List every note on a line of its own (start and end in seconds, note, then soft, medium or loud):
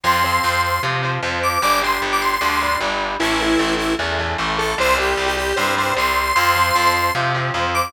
0.03 0.39 F2 medium
0.03 0.22 F3 medium
0.03 0.22 C4 medium
0.03 0.61 C6 loud
0.24 0.78 F3 medium
0.24 0.78 C4 medium
0.44 0.79 F2 medium
0.64 0.81 C6 medium
0.83 1.18 C3 medium
0.83 1.01 F3 medium
0.83 1.01 C4 medium
1.03 1.21 F3 medium
1.03 1.21 C4 medium
1.22 1.58 F2 medium
1.22 1.59 F3 medium
1.22 1.59 C4 medium
1.43 1.61 D6 medium
1.62 1.98 G1 medium
1.62 1.80 G3 medium
1.62 1.80 D4 medium
1.62 1.79 D6 loud
1.82 2.36 G3 medium
1.82 2.36 D4 medium
1.82 2.00 C6 medium
2.02 2.37 G1 medium
2.12 2.21 D6 medium
2.21 2.31 C6 medium
2.32 2.78 C6 medium
2.41 2.76 D2 medium
2.41 2.59 G3 medium
2.41 2.59 D4 medium
2.61 2.79 G3 medium
2.61 2.79 D4 medium
2.80 3.16 G1 medium
2.80 3.17 G3 medium
2.80 3.17 D4 medium
3.19 3.56 A1 medium
3.19 3.38 E3 loud
3.19 3.38 A3 loud
3.19 3.74 E4 loud
3.40 3.94 E3 medium
3.40 3.94 A3 medium
3.59 3.95 A1 medium
3.77 3.94 E4 loud
3.99 4.34 E2 medium
3.99 4.17 E3 medium
3.99 4.17 A3 medium
4.19 4.37 E3 medium
4.19 4.37 A3 medium
4.38 4.74 A1 medium
4.38 4.75 E3 medium
4.38 4.75 A3 medium
4.58 4.75 A4 loud
4.78 5.14 C2 loud
4.78 4.96 G3 medium
4.78 4.96 C4 medium
4.78 4.96 C5 loud
4.98 5.52 G3 medium
4.98 5.52 C4 medium
4.98 5.25 G4 loud
5.17 5.53 C2 medium
5.26 5.35 G4 loud
5.37 5.55 G4 loud
5.56 5.93 G2 medium
5.56 5.75 G3 medium
5.56 5.75 C4 medium
5.56 5.74 C5 loud
5.77 5.95 G3 medium
5.77 5.95 C4 medium
5.77 5.93 C5 loud
5.96 6.32 C2 medium
5.96 6.33 G3 medium
5.96 6.33 C4 medium
5.96 6.35 C6 loud
6.35 6.71 F2 medium
6.35 6.54 F3 medium
6.35 6.54 C4 loud
6.35 6.93 C6 loud
6.55 7.10 F3 medium
6.55 7.10 C4 medium
6.75 7.11 F2 medium
6.94 7.12 C6 loud
7.15 7.50 C3 medium
7.15 7.33 F3 medium
7.15 7.33 C4 medium
7.34 7.53 F3 medium
7.34 7.53 C4 medium
7.54 7.89 F2 medium
7.54 7.91 F3 medium
7.54 7.91 C4 medium
7.74 7.92 D6 loud